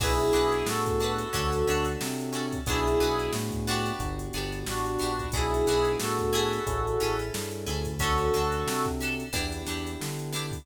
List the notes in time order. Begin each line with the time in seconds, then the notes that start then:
0.00 B1 B3 D4 E4 F#4 G#4 B4, kick, crash
0.19 closed hi-hat
0.33 B1 D4 F#4 G#4 B4, closed hi-hat
0.52 closed hi-hat
0.66 A2 F#4 A4, snare
0.86 kick, closed hi-hat
1.00 D4 F#4 G#4, closed hi-hat
1.04 B4
1.18 closed hi-hat
1.33 D2 C#4 D4 F#4 A4, kick, closed hi-hat
1.52 snare, closed hi-hat
1.67 D2 C#4 D4 F#4 A4, closed hi-hat
1.85 closed hi-hat
2.01 C3, snare
2.20 closed hi-hat
2.33 C#4 D4 F#4 A4, closed hi-hat
2.52 kick, closed hi-hat
2.66 B1 B3 D4 E4 F#4 G#4, kick, closed hi-hat
2.71 G#4
2.87 closed hi-hat
3.00 B1 B3 D4 F#4 G#4, closed hi-hat
3.19 closed hi-hat
3.33 A2, snare
3.51 kick, snare, closed hi-hat
3.67 B3 D4 F#4 G4, closed hi-hat
3.86 snare, closed hi-hat
3.99 G1 B3 D4 F#4 G4, kick, closed hi-hat
4.19 closed hi-hat
4.33 G1 B3 D4 F#4, closed hi-hat
4.37 G4
4.52 closed hi-hat
4.67 A1 D4 F#4, snare
4.86 closed hi-hat
4.99 A#1 B3 D4 F#4, closed hi-hat
5.03 G4
5.19 kick, closed hi-hat
5.32 B1 B3 D4 E4 F#4 G#4, kick, closed hi-hat
5.37 G#4
5.54 closed hi-hat
5.66 B1 B3 D4 F#4, snare, closed hi-hat
5.71 G#4
5.85 closed hi-hat
6.00 A2 F#4 A4, snare
6.18 kick, closed hi-hat
6.33 C#4 E4 G#4 A4, closed hi-hat
6.51 snare, closed hi-hat
6.67 A1 C#4 E4 G#4 A4, kick, closed hi-hat
6.87 closed hi-hat
7.00 A1 C#4 E4 G#4 A4, closed hi-hat
7.19 closed hi-hat
7.34 G2, snare
7.51 closed hi-hat
7.66 D2 C#4 E4 G#4 A4, closed hi-hat
7.85 kick, closed hi-hat
7.99 C#4 D4 F#4 A4, kick, closed hi-hat
8.03 A4
8.18 closed hi-hat
8.33 D2 C#4 D4 F#4 A4, closed hi-hat
8.52 closed hi-hat
8.67 C3, snare
8.85 kick, closed hi-hat
9.00 C#4 D4 F#4 A4, closed hi-hat
9.20 closed hi-hat
9.33 E2 B3 D4 E4 G4, kick, closed hi-hat
9.52 closed hi-hat
9.65 E2 B3 D4 E4, snare, closed hi-hat
9.70 G4
9.87 closed hi-hat
10.01 D3, snare
10.19 closed hi-hat
10.33 B3 D4 E4 G4, closed hi-hat
10.52 kick, snare, open hi-hat